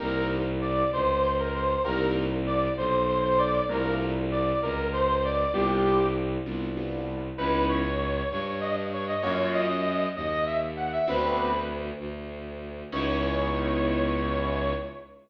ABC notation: X:1
M:6/8
L:1/16
Q:3/8=65
K:Cdor
V:1 name="Brass Section"
B2 z2 d2 c2 c B c2 | B2 z2 d2 c2 c c d2 | B2 z2 d2 B2 c c d2 | G4 z8 |
[K:C#dor] B2 c4 c c d z c d | c2 d4 d d e z f e | B4 z8 | c12 |]
V:2 name="Acoustic Grand Piano"
[B,CEG]12 | [B,CEG]12 | [A,B,DF]12 | [G,=B,DF]6 [G,B,DF]2 [G,B,DF]4 |
[K:C#dor] [B,CDE]12 | [A,C^EF]12 | [B,=C=DF]12 | [B,CDE]12 |]
V:3 name="Violin" clef=bass
C,,6 _D,,6 | C,,6 =B,,,6 | C,,6 _D,,6 | C,,6 C,,6 |
[K:C#dor] C,,6 =G,,6 | F,,6 D,,6 | =D,,6 D,,6 | C,,12 |]